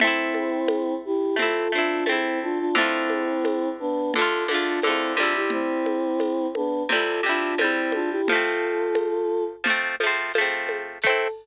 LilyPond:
<<
  \new Staff \with { instrumentName = "Choir Aahs" } { \time 4/4 \key a \minor \tempo 4 = 87 <c' e'>4. <e' g'>8 <f' a'>8 <d' f'>8 <c' e'>8 <d' f'>16 <d' f'>16 | <c' e'>4. <b d'>8 <f' a'>8 <d' f'>8 <c' e'>8 <d' f'>16 <e' g'>16 | <c' e'>4. <b d'>8 <f' a'>8 <d' f'>8 <c' e'>8 <d' f'>16 <e' g'>16 | <f' a'>2 r2 |
a'4 r2. | }
  \new Staff \with { instrumentName = "Acoustic Guitar (steel)" } { \time 4/4 \key a \minor <a c' e'>2 <a c' e'>8 <a c' e'>8 <a c' e'>4 | <d a f'>2 <d a f'>8 <d a f'>8 <d a f'>8 <c g e'>8~ | <c g e'>2 <c g e'>8 <c g e'>8 <c g e'>4 | <f a c'>2 <f a c'>8 <f a c'>8 <f a c'>4 |
<a c' e'>4 r2. | }
  \new DrumStaff \with { instrumentName = "Drums" } \drummode { \time 4/4 cgl8 cgho8 <cgho tamb>4 cgl4 <cgho tamb>4 | cgl8 cgho8 <cgho tamb>4 cgl8 cgho8 <cgho tamb>8 cgho8 | cgl8 cgho8 <cgho tamb>8 cgho8 cgl4 <cgho tamb>8 cgho8 | cgl4 <cgho tamb>4 cgl8 cgho8 <cgho tamb>8 cgho8 |
<cymc bd>4 r4 r4 r4 | }
>>